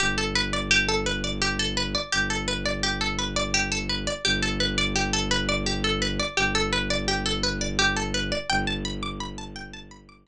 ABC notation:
X:1
M:12/8
L:1/8
Q:3/8=113
K:G
V:1 name="Pizzicato Strings"
G A B d G A B d G A B d | G A B d G A B d G A B d | G A B d G A B d G A B d | G A B d G A B d G A B d |
g a b d' b a g a b d' b z |]
V:2 name="Violin" clef=bass
G,,,12 | G,,,12 | G,,,12 | G,,,12 |
G,,,12 |]